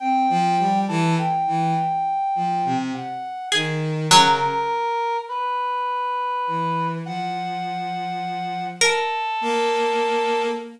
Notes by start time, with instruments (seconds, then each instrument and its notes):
0.00 violin C4, brass section G5
0.29 violin F3
0.59 violin G3
0.88 violin E3, brass section A4
1.18 brass section G5
1.47 violin E3
2.35 violin F3
2.65 violin C3
2.94 brass section F#5
3.52 violin D#3, pizzicato strings G#4
4.11 violin C#3, pizzicato strings F#3, brass section A#4
5.28 brass section B4
6.47 violin E3
7.06 violin F3, brass section F#5
8.81 brass section A4, pizzicato strings A#4
9.41 violin A#3